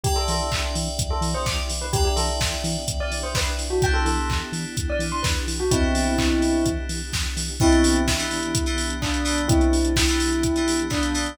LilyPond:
<<
  \new Staff \with { instrumentName = "Tubular Bells" } { \time 4/4 \key e \minor \tempo 4 = 127 g'16 a'16 a'8. r4 a'16 r16 c''16 d'''16 r8 b'16 | g'16 g'16 a'8. r4 d''16 r16 c''16 b'16 r8 fis'16 | g''16 a'16 a'8. r4 d''16 r16 c'''16 b'16 r8 fis'16 | <c' e'>2~ <c' e'>8 r4. |
<c' e'>4 e'2 d'4 | <c' e'>4 e'2 d'4 | }
  \new Staff \with { instrumentName = "Electric Piano 2" } { \time 4/4 \key e \minor <b' d'' e'' g''>1 | <b' d'' e'' g''>1 | <b d' e' g'>1 | <b d' e' g'>1 |
<e b d' g'>4~ <e b d' g'>16 <e b d' g'>4 <e b d' g'>8. <e b d' g'>8 <e b d' g'>8~ | <e b d' g'>4~ <e b d' g'>16 <e b d' g'>4 <e b d' g'>8. <e b d' g'>8 <e b d' g'>8 | }
  \new Staff \with { instrumentName = "Synth Bass 1" } { \clef bass \time 4/4 \key e \minor e,8 e8 e,8 e8 e,8 e8 e,8 e8 | e,8 e8 e,8 e8 e,8 e8 e,8 e8 | e,8 e8 e,8 e8 e,8 e8 e,8 e8 | e,8 e8 e,8 e8 e,8 e8 e,8 e8 |
r1 | r1 | }
  \new Staff \with { instrumentName = "Pad 2 (warm)" } { \time 4/4 \key e \minor <b d' e' g'>1 | <b d' e' g'>1 | <b d' e' g'>1 | <b d' e' g'>1 |
<e b d' g'>1~ | <e b d' g'>1 | }
  \new DrumStaff \with { instrumentName = "Drums" } \drummode { \time 4/4 <hh bd>8 hho8 <hc bd>8 hho8 <hh bd>8 hho8 <bd sn>8 hho8 | <hh bd>8 hho8 <bd sn>8 hho8 <hh bd>8 hho8 <bd sn>8 hho8 | <hh bd>8 hho8 <hc bd>8 hho8 <hh bd>8 hho8 <bd sn>8 hho8 | <hh bd>8 hho8 <hc bd>8 hho8 <hh bd>8 hho8 <bd sn>8 hho8 |
<cymc bd>16 hh16 hho16 hh16 <bd sn>16 hh16 hho16 hh16 <hh bd>16 hh16 hho16 hh16 <hc bd>16 hh16 hho16 hh16 | <hh bd>16 hh16 hho16 hh16 <bd sn>16 hh16 hho16 hh16 <hh bd>16 hh16 hho16 hh16 <hc bd>16 hh16 hho16 hh16 | }
>>